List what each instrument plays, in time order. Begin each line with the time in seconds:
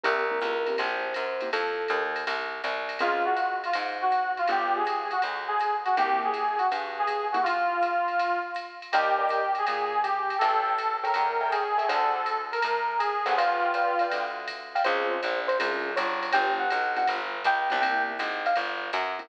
0.04 electric bass (finger) C2, acoustic grand piano A#3 C4 E4 G4, electric piano 1 A#4, ride
0.31 acoustic grand piano A#3 C4 E4 G4
0.41 electric bass (finger) C#2, hi-hat pedal, ride
0.67 acoustic grand piano A#3 C4 E4 G4, ride
0.78 electric bass (finger) A#1, electric piano 1 C5, ride
1.14 electric bass (finger) F#2, hi-hat pedal, ride
1.41 acoustic grand piano A#3 C4 E4 G4, ride
1.53 electric bass (finger) F2, electric piano 1 A4, ride
1.88 electric bass (finger) D#2, hi-hat pedal, ride
2.16 ride
2.27 electric bass (finger) C2, ride
2.64 electric bass (finger) C2, hi-hat pedal, ride
2.89 ride
2.99 electric bass (finger) C#2, acoustic grand piano C4 C#4 F4 G#4, brass section F4, ride
3.25 brass section F#4
3.37 hi-hat pedal, ride
3.64 brass section F4, ride
3.73 electric bass (finger) G#2, ride
4.01 brass section F#4
4.11 hi-hat pedal, ride
4.37 brass section F4, ride
4.48 electric bass (finger) G1, acoustic grand piano B3 D4 F4 G4, brass section G4, kick, ride
4.76 brass section G#4
4.86 hi-hat pedal, ride
5.11 brass section F#4, ride
5.22 electric bass (finger) D2, ride
5.48 brass section G#4
5.59 hi-hat pedal, ride
5.85 brass section F#4, ride
5.97 electric bass (finger) C2, acoustic grand piano A#3 C4 E4 G4, brass section G4, ride
6.24 brass section G#4
6.34 hi-hat pedal, ride
6.58 brass section F#4, ride
6.72 electric bass (finger) G2, ride
6.99 brass section G#4
7.07 kick, hi-hat pedal, ride
7.32 acoustic grand piano A#3 C4 E4 G4, brass section F#4, ride
7.43 brass section F4, kick, ride
7.82 hi-hat pedal, ride
8.08 ride
8.19 ride
8.55 hi-hat pedal, ride
8.82 ride
8.92 electric bass (finger) D#2, brass section G4, acoustic grand piano A#4 D5 D#5 G5, ride
9.19 acoustic grand piano A#4 D5 D#5 G5
9.29 hi-hat pedal, ride
9.55 brass section G#4, ride
9.67 electric bass (finger) A#2, ride
10.03 brass section G4, hi-hat pedal, ride
10.30 ride
10.39 electric bass (finger) A1, brass section A4, acoustic grand piano A4 C#5 E5 G5, ride
10.78 hi-hat pedal, ride
11.04 acoustic grand piano A4 C#5 E5 G5, brass section A#4, ride
11.14 electric bass (finger) E2, kick, ride
11.41 acoustic grand piano A4 C#5 E5 G5
11.51 brass section G#4, kick, hi-hat pedal, ride
11.78 acoustic grand piano A4 C#5 E5 G5, ride
11.89 electric bass (finger) D2, acoustic grand piano A4 C5 D5 F#5, brass section A4, ride
12.26 hi-hat pedal, ride
12.52 brass section A#4, ride
12.62 electric bass (finger) A2, kick, ride
12.98 brass section G#4, hi-hat pedal, ride
13.26 electric bass (finger) G1, acoustic grand piano A4 C5 D5 F#5, ride
13.36 brass section F4, acoustic grand piano B4 D5 F5 G5, kick, ride
13.74 acoustic grand piano B4 D5 F5 G5, hi-hat pedal, ride
13.99 acoustic grand piano B4 D5 F5 G5, ride
14.12 electric bass (finger) D2, kick, ride
14.48 kick, hi-hat pedal, ride
14.75 acoustic grand piano B4 D5 F5 G5, ride
14.84 electric bass (finger) C#2, acoustic grand piano C4 C#4 F4 G#4, electric piano 1 C5, ride
15.11 electric piano 1 C5
15.23 electric bass (finger) A#1, hi-hat pedal, ride
15.48 electric piano 1 C5, ride
15.59 electric bass (finger) C2, acoustic grand piano C4 C#4 F4 G#4, ride
15.96 electric bass (finger) G1, electric piano 1 C#5, hi-hat pedal, ride
16.23 ride
16.33 electric bass (finger) G1, acoustic grand piano B3 D4 F4 G4, electric piano 1 G5, ride
16.60 electric piano 1 F#5
16.70 electric bass (finger) B1, hi-hat pedal, ride
16.96 acoustic grand piano B3 D4 F4 G4, electric piano 1 F#5, ride
17.08 electric bass (finger) G1, kick, ride
17.44 electric bass (finger) C#2, electric piano 1 G5, kick, hi-hat pedal, ride
17.70 electric bass (finger) C2, acoustic grand piano B3 D4 F4 G4, ride
17.81 acoustic grand piano A#3 C4 E4 G4, electric piano 1 G5, ride
18.19 electric bass (finger) G#1, kick, hi-hat pedal, ride
18.46 electric piano 1 F5, ride
18.56 electric bass (finger) G1, ride
18.93 electric bass (finger) F#2, hi-hat pedal, ride
19.19 acoustic grand piano A#3 C4 E4 G4, ride